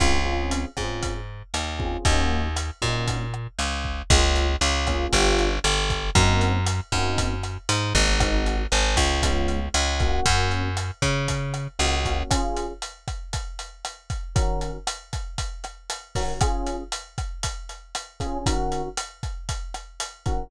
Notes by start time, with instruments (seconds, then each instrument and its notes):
0.00 electric bass (finger) C#2, electric piano 1 C4 C#4 F4 G#4, kick, cross-stick, closed hi-hat
0.26 electric piano 1 C4 C#4 F4 G#4
0.51 closed hi-hat
0.77 electric bass (finger) G#2, electric piano 1 C4 C#4 F4 G#4, kick, cross-stick
1.03 kick, closed hi-hat
1.54 electric bass (finger) D#2, cross-stick, closed hi-hat
1.79 electric piano 1 C4 C#4 F4 G#4, kick
2.05 electric bass (finger) D#2, electric piano 1 A#3 C#4 D#4 F#4, kick, closed hi-hat
2.56 cross-stick, closed hi-hat
2.82 electric bass (finger) A#2, electric piano 1 A#3 C#4 D#4 F#4, kick
3.08 kick, closed hi-hat
3.34 cross-stick
3.59 electric bass (finger) C#2, closed hi-hat
3.84 kick
4.10 electric bass (finger) C#2, electric piano 1 A#3 C#4 F4 G#4, kick, cross-stick, closed hi-hat
4.36 closed hi-hat
4.61 electric bass (finger) C#2, closed hi-hat
4.87 electric piano 1 A#3 C#4 F4 G#4, kick, cross-stick, closed hi-hat
5.13 electric bass (finger) G1, electric piano 1 B3 D4 F4 G4, kick, closed hi-hat
5.38 closed hi-hat
5.64 electric bass (finger) G1, cross-stick, closed hi-hat
5.90 kick, closed hi-hat
6.15 electric bass (finger) F#2, electric piano 1 A#3 C4 D#4 F#4, kick, closed hi-hat
6.41 closed hi-hat
6.66 cross-stick, closed hi-hat
6.92 electric bass (finger) F#2, electric piano 1 A#3 C4 D#4 F#4, kick, closed hi-hat
7.18 kick, closed hi-hat
7.43 cross-stick, closed hi-hat
7.69 electric bass (finger) G#2, closed hi-hat
7.94 electric bass (finger) G#1, electric piano 1 A#3 C4 D#4 F#4, kick, closed hi-hat
8.20 electric piano 1 G#3 C4 D#4 F#4, kick, cross-stick, closed hi-hat
8.46 closed hi-hat
8.72 electric bass (finger) G#1, closed hi-hat
8.97 electric bass (finger) C#2, kick, cross-stick, closed hi-hat
9.23 electric piano 1 G#3 B3 C#4 F4, kick, closed hi-hat
9.48 closed hi-hat
9.74 electric bass (finger) C#2, cross-stick, closed hi-hat
10.00 electric piano 1 A#3 C#4 F#4, kick, closed hi-hat
10.26 electric bass (finger) F#2, kick, closed hi-hat
10.51 closed hi-hat
10.77 cross-stick, closed hi-hat
11.02 electric bass (finger) C#3, kick, closed hi-hat
11.28 kick, closed hi-hat
11.54 cross-stick, closed hi-hat
11.79 electric bass (finger) C#2, electric piano 1 A#3 C#4 F#4, closed hi-hat
12.05 electric piano 1 A#3 C#4 F#4, kick, closed hi-hat
12.30 electric piano 1 C#4 F4 G#4, kick, cross-stick, closed hi-hat
12.57 closed hi-hat
12.82 closed hi-hat
13.08 kick, cross-stick, closed hi-hat
13.33 kick, closed hi-hat
13.59 closed hi-hat
13.85 cross-stick, closed hi-hat
14.10 kick, closed hi-hat
14.35 electric piano 1 D#3 C#4 F#4 A#4, kick, closed hi-hat
14.61 closed hi-hat
14.87 cross-stick, closed hi-hat
15.13 kick, closed hi-hat
15.38 kick, closed hi-hat
15.64 cross-stick, closed hi-hat
15.90 closed hi-hat
16.15 electric piano 1 D#3 C#4 F#4 A#4, kick, open hi-hat
16.41 electric piano 1 C#4 F4 G#4, kick, cross-stick, closed hi-hat
16.67 closed hi-hat
16.92 closed hi-hat
17.18 kick, cross-stick, closed hi-hat
17.43 kick, closed hi-hat
17.69 closed hi-hat
17.95 cross-stick, closed hi-hat
18.20 electric piano 1 C#4 F4 G#4, kick, closed hi-hat
18.46 electric piano 1 D#3 C#4 F#4 A#4, kick, closed hi-hat
18.72 closed hi-hat
18.97 cross-stick, closed hi-hat
19.23 kick, closed hi-hat
19.49 kick, closed hi-hat
19.74 cross-stick, closed hi-hat
20.00 closed hi-hat
20.26 electric piano 1 D#3 C#4 F#4 A#4, kick, closed hi-hat